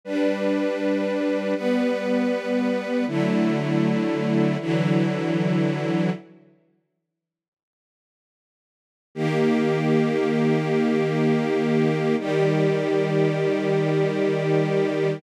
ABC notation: X:1
M:4/4
L:1/8
Q:1/4=79
K:D
V:1 name="String Ensemble 1"
[G,DB]4 [G,B,B]4 | [D,F,A,E]4 [D,E,F,E]4 | z8 | [K:Eb] [E,B,G]8 |
[E,G,G]8 |]